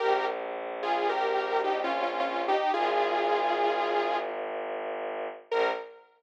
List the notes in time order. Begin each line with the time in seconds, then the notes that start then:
0.00 A#1 G4 A#4
0.83 F4 G#4
1.09 G4 A#4
1.64 D#4 G4
1.84 C#4 F4
2.02 C#4 F4
2.20 C#4 F4
2.48 D#4 G4
2.74 G#1 F4 G#4
5.51 A#1 A#4